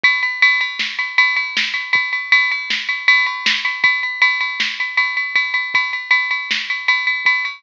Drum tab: RD |xxxx-xxx-x|xxxx-xxx-x|xxxx-xxxxx|xxxx-xxxxx|
SD |----o---o-|----o---o-|----o-----|----o-----|
BD |o---------|o---------|o-------o-|o-------o-|